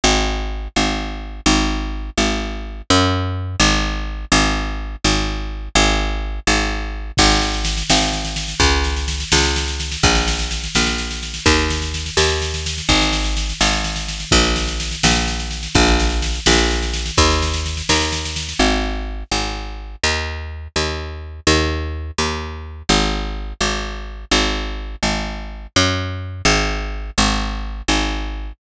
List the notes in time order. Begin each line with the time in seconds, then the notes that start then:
0.04 G#1
0.76 G#1
1.46 G#1
2.18 G#1
2.90 F#2
3.60 G#1
4.32 G#1
5.04 G#1
5.75 G#1
6.47 G#1
7.17 G#1, kick, snare, crash
7.30 snare
7.42 snare
7.54 snare
7.65 snare
7.77 snare
7.90 G#1, snare
8.01 snare
8.13 snare
8.25 snare
8.36 snare
8.48 snare
8.60 C#2, kick, snare
8.84 snare
8.96 snare
9.08 snare
9.20 snare
9.32 C#2, snare
9.44 snare
9.56 snare
9.68 snare
9.80 snare
9.91 snare
10.03 A#1, kick, snare
10.15 snare
10.28 snare
10.39 snare
10.51 snare
10.64 snare
10.75 A#1, snare
10.87 snare
10.98 snare
11.11 snare
11.23 snare
11.34 snare
11.46 D#2, kick, snare
11.59 snare
11.70 snare
11.82 snare
11.94 snare
12.06 snare
12.17 D#2, snare
12.29 snare
12.42 snare
12.54 snare
12.66 snare
12.78 snare
12.89 G#1, kick, snare
13.02 snare
13.13 snare
13.24 snare
13.37 snare
13.50 snare
13.61 G#1, snare
13.73 snare
13.84 snare
13.96 snare
14.08 snare
14.20 snare
14.31 A#1, kick, snare
14.44 snare
14.56 snare
14.68 snare
14.80 snare
14.91 snare
15.03 A#1, snare
15.15 snare
15.28 snare
15.40 snare
15.51 snare
15.63 snare
15.75 A#1, kick, snare
15.87 snare
15.99 snare
16.10 snare
16.22 snare
16.34 snare
16.46 A#1, snare
16.58 snare
16.71 snare
16.82 snare
16.93 snare
17.06 snare
17.17 D#2, kick, snare
17.30 snare
17.42 snare
17.54 snare
17.66 snare
17.77 snare
17.89 D#2, snare
18.01 snare
18.12 snare
18.25 snare
18.36 snare
18.49 snare
18.59 G#1
19.31 G#1
20.03 D#2
20.76 D#2
21.47 D#2
22.18 D#2
22.89 G#1
23.61 G#1
24.31 G#1
25.03 G#1
25.76 F#2
26.45 G#1
27.18 G#1
27.88 G#1